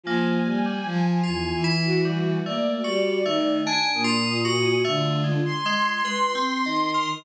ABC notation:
X:1
M:2/4
L:1/16
Q:1/4=50
K:none
V:1 name="Violin"
(3F,2 G,2 F,2 E,, E,3 | (3_B,2 G,2 _E,2 z _B,,3 | D,2 z4 _E,2 |]
V:2 name="Violin"
_a6 _G2 | d4 _a _e'3 | F2 c'6 |]
V:3 name="Electric Piano 2"
_B,2 G, z (3F2 E2 G,2 | (3A,2 _G2 A,2 (3D2 F2 G2 | (3A,2 _A,2 A,2 B C _e _B |]